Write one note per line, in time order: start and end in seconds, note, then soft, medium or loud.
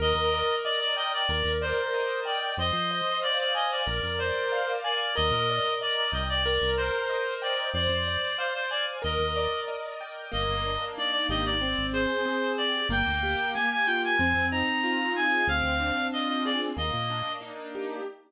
0.00 0.14 D#2 loud
0.00 1.22 A#4 loud
0.00 0.56 D#5 loud
0.14 0.43 D#2 medium
0.33 1.25 D5 medium
0.64 0.80 D5 loud
0.64 1.26 D#5 medium
0.80 0.96 D5 loud
0.97 1.12 D#5 loud
0.97 1.27 G5 medium
1.13 1.52 D5 loud
1.29 1.43 D#2 loud
1.29 2.52 A#4 medium
1.44 1.74 D#2 medium
1.62 2.20 C5 loud
1.62 2.53 D5 medium
1.94 2.56 D#5 medium
2.25 2.55 D5 medium
2.25 2.56 G5 medium
2.57 2.72 F2 loud
2.57 3.81 C5 medium
2.57 3.19 D#5 loud
2.73 3.02 F3 medium
2.91 3.83 D#5 medium
3.22 3.38 D5 loud
3.22 3.83 F5 medium
3.39 3.54 D5 loud
3.55 3.71 D#5 loud
3.55 3.85 G#5 medium
3.71 4.19 D5 medium
3.86 4.01 A#1 loud
3.86 5.09 A#4 medium
4.03 4.32 F2 medium
4.19 4.72 C5 loud
4.19 5.11 D5 medium
4.52 5.13 F5 medium
4.84 5.15 D5 loud
4.84 5.15 G#5 medium
5.15 5.32 D#2 loud
5.15 6.38 A#4 medium
5.15 5.74 D#5 loud
5.31 5.60 A#2 medium
5.50 6.42 D5 medium
5.81 5.96 D5 loud
5.81 6.42 D#5 medium
5.96 6.12 D5 loud
6.12 6.59 C2 loud
6.12 6.28 D#5 medium
6.12 6.43 G5 medium
6.29 6.70 D5 loud
6.46 7.68 A#4 loud
6.62 6.91 C2 medium
6.77 7.34 C5 loud
6.77 7.70 C5 medium
7.09 7.71 D#5 medium
7.42 7.70 D5 loud
7.42 7.73 G5 medium
7.74 7.88 F2 loud
7.74 8.97 C5 medium
7.74 8.37 D5 loud
7.89 8.18 F2 medium
8.08 8.99 D5 medium
8.38 8.53 C5 loud
8.38 9.00 F5 medium
8.55 8.70 C5 loud
8.70 8.86 D5 loud
8.70 9.02 G#5 medium
9.02 9.18 D#2 loud
9.02 10.25 A#4 medium
9.02 9.60 D#5 loud
9.19 9.48 D#2 medium
9.36 10.28 D5 medium
9.68 10.29 D#5 medium
10.01 10.31 G5 medium
10.32 10.48 G1 loud
10.32 11.54 A#3 medium
10.32 10.85 D#5 loud
10.49 10.78 G1 medium
10.65 11.57 D4 medium
10.98 11.59 D#4 medium
10.98 11.11 D5 loud
11.12 11.27 D5 loud
11.29 11.76 G#1 loud
11.29 11.61 G4 medium
11.29 11.45 D#5 loud
11.45 11.86 D5 loud
11.61 12.25 C4 medium
11.78 12.07 G#1 medium
11.93 12.85 G#4 medium
11.93 12.52 C5 loud
12.26 12.87 C4 medium
12.58 12.89 G4 medium
12.58 12.88 D5 loud
12.89 13.04 G1 loud
12.89 13.55 A#3 loud
12.89 13.51 G5 loud
13.07 13.36 D2 medium
13.23 14.15 G4 medium
13.54 14.17 A#3 medium
13.54 13.69 G#5 loud
13.71 13.87 G#5 loud
13.86 14.18 F4 medium
13.86 14.02 G5 loud
14.04 14.47 G#5 loud
14.19 14.34 F2 loud
14.19 15.42 C4 medium
14.34 14.63 F2 medium
14.51 15.44 D#4 medium
14.51 15.13 A#5 loud
14.84 15.45 F4 medium
15.16 15.48 G#4 medium
15.16 15.47 G#5 loud
15.47 15.62 D2 loud
15.47 16.71 C4 medium
15.47 16.07 F5 loud
15.63 15.92 D2 medium
15.80 16.72 D4 medium
16.12 16.74 F4 medium
16.12 16.28 D#5 loud
16.28 16.44 D#5 loud
16.45 16.76 G#4 medium
16.45 16.60 D5 loud
16.76 16.91 D#2 loud
16.76 17.99 A#3 medium
16.76 17.33 D#5 loud
16.93 17.22 A#2 medium
17.10 18.02 D4 medium
17.41 18.02 D#4 medium
17.75 18.06 G4 medium